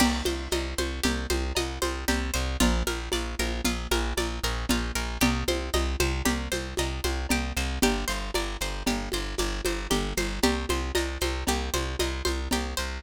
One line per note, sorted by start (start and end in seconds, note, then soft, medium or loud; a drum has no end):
0.00 0.22 C2 loud
0.00 0.23 G4 medium
0.00 crash loud
0.00 cowbell loud
0.00 low conga loud
0.00 shaker medium
0.25 0.48 C2 medium
0.25 0.49 C5 medium
0.25 high conga loud
0.25 shaker medium
0.51 0.74 C2 medium
0.51 0.76 D#5 medium
0.51 cowbell medium
0.51 high conga loud
0.51 shaker medium
0.78 1.00 C2 medium
0.78 1.02 C5 medium
0.78 high conga medium
0.78 shaker medium
1.03 1.27 C2 medium
1.03 1.27 G4 medium
1.03 cowbell medium
1.03 low conga loud
1.03 shaker loud
1.30 1.53 C2 medium
1.30 1.53 C5 medium
1.30 high conga loud
1.30 shaker medium
1.55 1.79 C2 medium
1.55 1.80 D#5 medium
1.55 cowbell medium
1.55 high conga medium
1.55 shaker loud
1.82 2.05 C2 medium
1.82 2.05 C5 medium
1.82 high conga medium
1.82 shaker medium
2.08 2.31 C2 medium
2.08 2.32 G4 medium
2.08 cowbell loud
2.08 low conga medium
2.08 shaker loud
2.34 2.57 C2 medium
2.34 2.57 C5 medium
2.34 shaker medium
2.60 2.83 A#1 loud
2.60 2.84 F4 medium
2.60 cowbell loud
2.60 low conga loud
2.60 shaker loud
2.87 3.09 A#1 medium
2.87 3.10 A#4 medium
2.87 high conga medium
2.87 shaker medium
3.12 3.35 A#1 medium
3.12 3.36 D5 medium
3.12 cowbell medium
3.12 high conga medium
3.12 shaker medium
3.39 3.61 A#1 medium
3.39 3.63 A#4 medium
3.39 high conga medium
3.39 shaker medium
3.64 3.87 A#1 medium
3.64 3.88 F4 medium
3.64 cowbell medium
3.64 low conga medium
3.64 shaker loud
3.91 4.13 A#1 medium
3.91 4.15 A#4 medium
3.91 high conga loud
3.91 shaker medium
4.17 4.40 A#1 medium
4.17 4.41 D5 medium
4.17 cowbell medium
4.17 high conga medium
4.17 shaker medium
4.43 4.66 A#1 medium
4.43 4.67 A#4 medium
4.43 shaker medium
4.69 4.92 A#1 medium
4.69 4.94 F4 medium
4.69 cowbell medium
4.69 low conga loud
4.69 shaker medium
4.95 5.18 A#1 medium
4.95 5.19 A#4 medium
4.95 shaker medium
5.20 5.44 C2 medium
5.20 5.45 G4 medium
5.20 cowbell loud
5.20 low conga loud
5.20 shaker loud
5.48 5.70 C2 medium
5.48 5.72 C5 medium
5.48 high conga loud
5.48 shaker medium
5.73 5.96 C2 medium
5.73 5.97 D#5 medium
5.73 cowbell medium
5.73 high conga medium
5.73 shaker medium
6.00 6.22 C2 medium
6.00 6.24 C5 medium
6.00 high conga loud
6.00 shaker medium
6.25 6.48 C2 medium
6.25 6.49 G4 medium
6.25 cowbell medium
6.25 low conga loud
6.25 shaker medium
6.52 6.74 C2 medium
6.52 6.75 C5 medium
6.52 high conga medium
6.52 shaker medium
6.77 7.00 C2 medium
6.77 7.02 D#5 medium
6.77 cowbell loud
6.77 high conga medium
6.77 shaker loud
7.04 7.27 C2 medium
7.04 7.27 C5 medium
7.04 high conga medium
7.04 shaker medium
7.29 7.53 C2 medium
7.29 7.55 G4 medium
7.29 cowbell medium
7.29 low conga loud
7.29 shaker medium
7.57 7.79 C2 medium
7.57 7.81 C5 medium
7.57 shaker medium
7.82 8.05 G1 medium
7.82 8.07 G4 medium
7.82 cowbell loud
7.82 low conga loud
7.82 shaker medium
8.08 8.31 G1 medium
8.08 8.31 C5 medium
8.08 shaker medium
8.34 8.57 G1 medium
8.34 8.59 D5 medium
8.34 cowbell loud
8.34 high conga medium
8.34 shaker medium
8.61 8.83 G1 medium
8.61 8.85 C5 medium
8.61 shaker medium
8.86 9.09 G1 medium
8.86 9.11 G4 medium
8.86 cowbell medium
8.86 low conga loud
8.86 shaker medium
9.12 9.35 G1 medium
9.12 9.37 C5 medium
9.12 high conga medium
9.12 shaker medium
9.38 9.61 G1 medium
9.38 9.63 D5 medium
9.38 cowbell medium
9.38 high conga medium
9.38 shaker loud
9.65 9.87 G1 medium
9.65 9.89 C5 medium
9.65 high conga medium
9.65 shaker medium
9.90 10.13 G1 medium
9.90 10.14 G4 medium
9.90 cowbell medium
9.90 low conga medium
9.90 shaker medium
10.17 10.40 G1 medium
10.17 10.41 C5 medium
10.17 high conga medium
10.17 shaker medium
10.42 10.66 C2 medium
10.42 11.48 G4 medium
10.42 cowbell loud
10.42 low conga loud
10.42 shaker medium
10.69 10.92 C2 medium
10.69 11.21 C5 medium
10.69 high conga medium
10.69 shaker medium
10.95 11.18 C2 medium
10.95 11.99 D#5 medium
10.95 cowbell loud
10.95 high conga loud
10.95 shaker loud
11.21 11.44 C2 medium
11.21 11.73 C5 medium
11.21 high conga medium
11.21 shaker medium
11.47 11.70 C2 medium
11.47 12.52 G4 medium
11.47 cowbell medium
11.47 low conga medium
11.47 shaker loud
11.74 11.96 C2 medium
11.74 12.24 C5 medium
11.74 high conga medium
11.74 shaker medium
11.99 12.22 C2 medium
11.99 12.99 D#5 medium
11.99 cowbell medium
11.99 high conga loud
11.99 shaker medium
12.25 12.48 C2 medium
12.25 12.77 C5 medium
12.25 high conga medium
12.25 shaker medium
12.51 12.74 C2 medium
12.51 13.02 G4 medium
12.51 cowbell loud
12.51 low conga loud
12.51 shaker loud
12.77 13.00 C2 medium
12.77 13.02 C5 medium
12.77 shaker medium